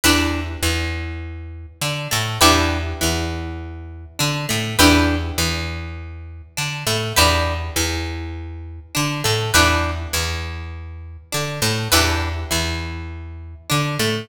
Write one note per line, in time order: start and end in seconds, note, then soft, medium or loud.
0.04 0.57 E2 medium
0.04 0.41 D4 loud
0.04 0.41 E4 loud
0.04 0.41 G4 medium
0.04 0.41 B4 loud
0.62 1.66 E2 medium
0.62 1.66 E3 medium
1.81 2.08 D3 medium
1.81 2.08 D4 medium
2.11 2.39 A2 medium
2.11 2.37 A3 medium
2.41 2.94 E2 loud
2.41 2.78 D4 loud
2.41 2.78 E4 loud
2.41 2.78 G4 loud
2.41 2.78 B4 loud
3.01 4.06 E2 medium
3.01 4.05 E3 medium
4.19 4.46 D3 medium
4.19 4.45 D4 medium
4.49 4.76 A2 medium
4.49 4.75 A3 medium
4.79 5.32 E2 loud
4.79 5.16 D4 loud
4.79 5.16 E4 loud
4.79 5.16 G4 loud
4.79 5.16 B4 loud
5.38 6.42 E2 medium
5.38 6.42 E3 medium
6.57 6.84 D3 medium
6.57 6.83 D4 medium
6.87 7.13 A2 medium
6.87 7.13 A3 medium
7.16 7.71 E2 loud
7.16 7.53 D4 loud
7.16 7.53 E4 loud
7.16 7.53 G4 loud
7.16 7.53 B4 loud
7.76 8.80 E2 medium
7.76 8.80 E3 medium
8.95 9.23 D3 medium
8.95 9.21 D4 medium
9.24 9.52 A2 medium
9.24 9.50 A3 medium
9.54 10.07 E2 medium
9.54 9.91 D4 loud
9.54 9.91 E4 loud
9.54 9.91 G4 medium
9.54 9.91 B4 loud
10.13 11.17 E2 medium
10.13 11.17 E3 medium
11.32 11.60 D3 medium
11.32 11.59 D4 medium
11.62 11.88 A2 medium
11.62 11.88 A3 medium
11.92 12.45 E2 loud
11.92 12.29 D4 loud
11.92 12.29 E4 loud
11.92 12.29 G4 loud
11.92 12.29 B4 loud
12.51 13.55 E2 medium
12.51 13.54 E3 medium
13.70 13.98 D3 medium
13.70 13.96 D4 medium
13.99 14.26 A2 medium
13.99 14.26 A3 medium